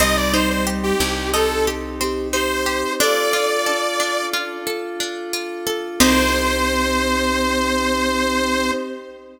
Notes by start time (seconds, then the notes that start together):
0.00 C2 G3 C4 D#4 G4 D#5
0.17 D5
0.33 D#4 C5
0.50 C5
0.67 G4
0.83 G4
1.00 C2 C4
1.33 D#4 A4
1.67 G4
2.01 C4 G4
2.32 D#4 G4 C5
2.66 G4
2.99 D4 F4 A4 D5
3.33 F4
3.66 D4 A4
4.00 D4
4.33 F4
4.67 A4
5.00 D4
5.33 F4
5.67 A4
6.00 C2 C4 D#4 G4 C5